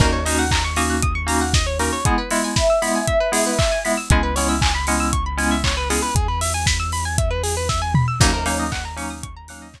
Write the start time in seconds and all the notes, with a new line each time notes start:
0.00 D#2 A#3 C#4 D#4 F#4 A#4, kick, crash
0.12 C#5
0.25 A#3 C#4 D#4 F#4 D#5, open hi-hat
0.39 F#5
0.51 A#5, kick, clap
0.64 C#6
0.76 A#3 C#4 D#4 F#4 D#6, open hi-hat
0.90 F#6
1.02 D#6, kick, closed hi-hat
1.15 C#6
1.27 A#3 C#4 D#4 F#4 A#5, open hi-hat
1.41 F#5
1.54 D#5, kick, snare
1.66 C#5
1.79 A#3 C#4 D#4 F#4 A#4, open hi-hat
1.93 C#5
2.05 G#3 B3 E4 G#4, kick, closed hi-hat
2.18 B4
2.31 G#3 B3 E4 E5, open hi-hat
2.44 G#5
2.56 E5 B5, kick, snare
2.70 E6
2.82 G#3 B3 E4 B5, open hi-hat
2.95 G#5
3.07 E5, kick, closed hi-hat
3.20 B4
3.32 G#3 B3 E4 G#4, open hi-hat
3.46 B4
3.59 E5, kick, clap
3.72 G#5
3.85 G#3 B3 E4 B5, open hi-hat
3.97 E6
4.10 C#2 G#3 B3 C#4 E4 G#4, kick, closed hi-hat
4.23 B4
4.36 G#3 B3 C#4 E4 C#5, open hi-hat
4.49 E5
4.61 G#5, kick, clap
4.75 B5
4.87 G#3 B3 C#4 E4 C#6, open hi-hat
5.00 E6
5.13 C#6, kick, closed hi-hat
5.26 B5
5.38 G#3 B3 C#4 E4 G#5, open hi-hat
5.51 E5
5.64 C#5, kick, clap
5.77 B4
5.90 G#3 B3 C#4 E4 G#4, open hi-hat
6.02 B4
6.15 E2 G#4, kick, closed hi-hat
6.28 B4
6.41 E5, open hi-hat
6.54 G#5
6.66 B5, kick, snare
6.80 E6
6.92 B5, open hi-hat
7.05 G#5
7.18 E5, kick, closed hi-hat
7.30 B4
7.43 G#4, open hi-hat
7.57 B4
7.69 E5, kick, snare
7.82 G#5
7.94 B5, mid tom
8.08 E6
8.20 D#2 F#3 A#3 C#4 D#4 F#4, kick, crash
8.34 A#4
8.46 F#3 A#3 C#4 D#4 C#5, open hi-hat
8.59 D#5
8.72 F#5, kick, clap
8.85 A#5
8.96 F#3 A#3 C#4 D#4 C#6, open hi-hat
9.10 D#6
9.23 C#6, kick, closed hi-hat
9.36 A#5
9.48 F#3 A#3 C#4 D#4 F#5, open hi-hat
9.62 D#5
9.74 C#5, kick, clap